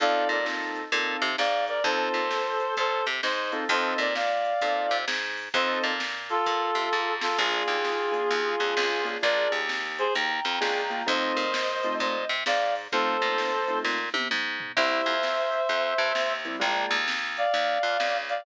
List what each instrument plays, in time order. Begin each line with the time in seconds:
0.00 electric bass (finger) F2, acoustic grand piano C4 D#4 F4 A4, clarinet D5 F5, kick, closed hi-hat
0.29 electric bass (finger) A#2, clarinet A#4 D5, closed hi-hat
0.45 acoustic grand piano C4 D#4 F4 A4, snare
0.75 closed hi-hat
0.92 electric bass (finger) A#2, acoustic grand piano C4 D#4 F4 A4, kick, closed hi-hat
1.22 electric bass (finger) C3, closed hi-hat
1.38 electric bass (finger) G#2, clarinet D5 F5, snare
1.68 clarinet A#4 D5, closed hi-hat
1.84 electric bass (finger) F2, acoustic grand piano C4 D#4 F4 A4, clarinet A4 C5, kick, closed hi-hat
2.14 electric bass (finger) A#2, closed hi-hat
2.31 snare
2.60 closed hi-hat
2.77 electric bass (finger) A#2, clarinet A4 C5, kick, closed hi-hat
3.06 electric bass (finger) C3, closed hi-hat
3.23 electric bass (finger) G#2, clarinet C5 D#5, snare
3.52 acoustic grand piano C4 D#4 F4 A4, closed hi-hat
3.69 electric bass (finger) F2, acoustic grand piano C4 D#4 F4 A4, clarinet C5 D#5, kick, closed hi-hat
3.98 electric bass (finger) A#2, clarinet A#4 D5, closed hi-hat
4.15 clarinet D5 F5, snare
4.45 closed hi-hat
4.61 electric bass (finger) A#2, acoustic grand piano C4 D#4 F4 A4, kick, closed hi-hat
4.91 electric bass (finger) C3, closed hi-hat
5.08 electric bass (finger) G#2, snare
5.37 open hi-hat
5.54 electric bass (finger) F2, acoustic grand piano C4 D#4 F4 A4, clarinet C5 D#5, kick, closed hi-hat
5.83 electric bass (finger) A#2, closed hi-hat
6.00 snare
6.29 clarinet F4 A4, closed hi-hat
6.46 electric bass (finger) A#2, kick, closed hi-hat
6.75 electric bass (finger) C3, closed hi-hat
6.92 electric bass (finger) G#2, kick
7.21 clarinet F4 A4, snare
7.38 electric bass (finger) A#1, acoustic grand piano A#3 D4 F4 G#4, clarinet F4 G#4, kick, crash
7.67 electric bass (finger) D#2, closed hi-hat
7.85 snare
8.12 acoustic grand piano A#3 D4 F4 G#4, closed hi-hat
8.31 electric bass (finger) D#2, kick, closed hi-hat
8.60 electric bass (finger) F2, acoustic grand piano A#3 D4 F4 G#4, closed hi-hat
8.77 electric bass (finger) C#2, snare
9.04 acoustic grand piano A#3 D4 F4 G#4, closed hi-hat
9.22 electric bass (finger) A#1, acoustic grand piano A#3 D4 F4 G#4, clarinet A#4 D5, kick, closed hi-hat
9.52 electric bass (finger) D#2, closed hi-hat
9.69 snare
9.98 clarinet G#4 C5, closed hi-hat
10.14 electric bass (finger) D#2, clarinet G5 A#5, kick, closed hi-hat
10.45 electric bass (finger) F2, closed hi-hat
10.61 electric bass (finger) C#2, acoustic grand piano A#3 D4 F4 G#4, snare
10.90 acoustic grand piano A#3 D4 F4 G#4, closed hi-hat
11.06 electric bass (finger) F2, acoustic grand piano A3 C4 D#4 F4, clarinet C5 D#5, kick, closed hi-hat
11.37 electric bass (finger) A#2, closed hi-hat
11.54 snare
11.83 acoustic grand piano A3 C4 D#4 F4, closed hi-hat
12.00 electric bass (finger) A#2, clarinet C5 D#5, kick, closed hi-hat
12.29 electric bass (finger) C3, closed hi-hat
12.46 electric bass (finger) G#2, clarinet D5 F5, snare
12.75 open hi-hat
12.92 electric bass (finger) F2, acoustic grand piano A3 C4 D#4 F4, clarinet A4 C5, kick, closed hi-hat
13.21 electric bass (finger) A#2, acoustic grand piano A3 C4 D#4 F4, closed hi-hat
13.38 snare
13.68 acoustic grand piano A3 C4 D#4 F4, closed hi-hat
13.84 electric bass (finger) A#2, kick, snare
14.14 electric bass (finger) C3, high tom
14.31 electric bass (finger) G#2, mid tom
14.60 floor tom
14.76 electric bass (finger) C2, acoustic grand piano G3 A#3 C4 E4, clarinet C5 E5, kick, crash
15.06 electric bass (finger) F2, closed hi-hat
15.23 snare
15.52 closed hi-hat
15.69 electric bass (finger) F2, kick, closed hi-hat
15.98 electric bass (finger) G2, closed hi-hat
16.15 electric bass (finger) D#2, snare
16.45 acoustic grand piano G3 A#3 C4 E4, closed hi-hat
16.60 electric bass (finger) A#1, acoustic grand piano G#3 A#3 D4 F4, clarinet G5 A#5, kick, closed hi-hat
16.91 electric bass (finger) D#2, closed hi-hat
17.08 snare
17.37 clarinet D5 F5, closed hi-hat
17.54 electric bass (finger) D#2, kick, closed hi-hat
17.83 electric bass (finger) F2, closed hi-hat
18.00 electric bass (finger) C#2, snare
18.29 clarinet D5 F5, closed hi-hat